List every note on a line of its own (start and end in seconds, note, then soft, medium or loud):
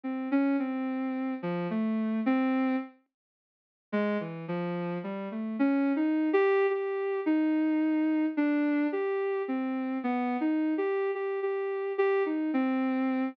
0.03 0.28 C4 medium
0.31 0.56 C#4 medium
0.59 1.34 C4 medium
1.42 1.67 F3 medium
1.70 2.20 A3 medium
2.26 2.76 C4 loud
3.92 4.17 G#3 loud
4.20 4.45 E3 medium
4.48 4.98 F3 medium
5.03 5.28 G3 medium
5.31 5.56 A3 medium
5.59 5.92 C#4 medium
5.96 6.29 D#4 medium
6.33 6.66 G4 loud
6.70 7.20 G4 medium
7.26 8.26 D#4 medium
8.37 8.87 D4 medium
8.92 9.42 G4 medium
9.48 9.98 C4 medium
10.03 10.37 B3 medium
10.41 10.74 D#4 medium
10.78 11.11 G4 medium
11.15 11.40 G4 medium
11.43 11.93 G4 medium
11.98 12.23 G4 medium
12.26 12.51 D#4 soft
12.53 13.28 C4 medium